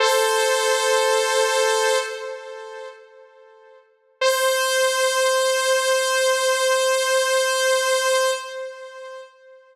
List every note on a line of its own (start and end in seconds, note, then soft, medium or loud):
0.00 1.98 A4 medium
0.00 1.98 C5 medium
4.21 8.31 C5 loud